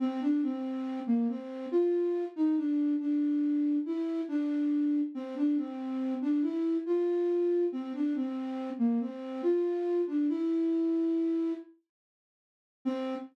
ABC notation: X:1
M:3/4
L:1/16
Q:1/4=70
K:Cmix
V:1 name="Flute"
C D C3 B, C2 F3 _E | D2 D4 E2 D4 | C D C3 D E2 F4 | C D C3 B, C2 F3 D |
E6 z6 | C4 z8 |]